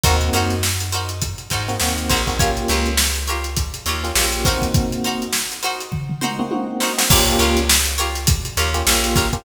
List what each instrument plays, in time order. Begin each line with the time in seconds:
0.04 electric bass (finger) D#2, electric piano 1 A#3 C4 D#4 F#4, pizzicato strings D#4 F#4 A#4 C5, kick, closed hi-hat
0.21 closed hi-hat
0.33 electric bass (finger) F#2, pizzicato strings D#4 F#4 A#4 C5, closed hi-hat
0.50 snare, closed hi-hat
0.63 snare
0.80 closed hi-hat
0.92 pizzicato strings D#4 F#4 A#4 C5, closed hi-hat
1.09 closed hi-hat
1.22 kick, closed hi-hat
1.38 closed hi-hat
1.50 electric bass (finger) G#2, pizzicato strings D#4 F#4 A#4 C5, kick, closed hi-hat
1.68 electric piano 1 A#3 C4 D#4 F#4, snare, closed hi-hat
1.80 electric bass (finger) D#2, electric piano 1 A#3 C4 D#4 F#4, snare
1.98 closed hi-hat
2.09 electric bass (finger) A#1, pizzicato strings D#4 F#4 A#4 C5, kick, snare, closed hi-hat
2.27 electric piano 1 A#3 C4 D#4 F#4, kick, open hi-hat
2.39 electric piano 1 A#3 C#4 F4 G4, pizzicato strings F4 G4 A#4 C#5, kick, closed hi-hat
2.57 closed hi-hat
2.68 electric bass (finger) C#2, pizzicato strings F4 G4 A#4 C#5, closed hi-hat
2.86 closed hi-hat
2.97 snare
3.15 closed hi-hat
3.27 pizzicato strings F4 G4 A#4 C#5, closed hi-hat
3.44 closed hi-hat
3.56 kick, closed hi-hat
3.74 closed hi-hat
3.86 electric bass (finger) D#2, pizzicato strings F4 G4 A#4 C#5, closed hi-hat
4.04 electric piano 1 A#3 C#4 F4 G4, snare, closed hi-hat
4.15 electric bass (finger) A#1, electric piano 1 A#3 C#4 F4 G4, snare
4.32 closed hi-hat
4.45 electric piano 1 A#3 C4 D#4 F#4, pizzicato strings D#4 F#4 A#4 C5, kick, snare, closed hi-hat
4.62 kick, closed hi-hat
4.74 kick, closed hi-hat
4.92 closed hi-hat
5.04 pizzicato strings D#4 F#4 A#4 C5, closed hi-hat
5.22 closed hi-hat
5.33 snare
5.51 snare, closed hi-hat
5.63 pizzicato strings D#4 F#4 A#4 C5, snare, closed hi-hat
5.80 closed hi-hat
5.92 kick, floor tom
6.09 floor tom
6.21 pizzicato strings D#4 F#4 A#4 C5, mid tom
6.39 electric piano 1 A#3 C4 D#4 F#4, mid tom
6.51 electric piano 1 A#3 C4 D#4 F#4, high tom
6.80 pizzicato strings D#4 F#4 A#4 C5, snare
6.98 electric piano 1 A#3 C4 D#4 F#4, snare
7.10 electric bass (finger) A#1, electric piano 1 A#3 C#4 F4 G4, pizzicato strings F4 G4 A#4 C#5, kick, crash
7.26 snare, closed hi-hat
7.39 electric bass (finger) C#2, pizzicato strings F4 G4 A#4 C#5, closed hi-hat
7.57 closed hi-hat
7.69 snare
7.85 closed hi-hat
7.98 pizzicato strings F4 G4 A#4 C#5, closed hi-hat
8.15 snare, closed hi-hat
8.27 kick, closed hi-hat
8.45 closed hi-hat
8.57 electric bass (finger) D#2, pizzicato strings F4 G4 A#4 C#5, closed hi-hat
8.74 electric piano 1 A#3 C#4 F4 G4, closed hi-hat
8.87 electric bass (finger) A#1, electric piano 1 A#3 C#4 F4 G4, snare
9.04 closed hi-hat
9.16 pizzicato strings F4 G4 A#4 C#5, kick, snare, closed hi-hat
9.33 electric piano 1 A#3 C#4 F4 G4, kick, closed hi-hat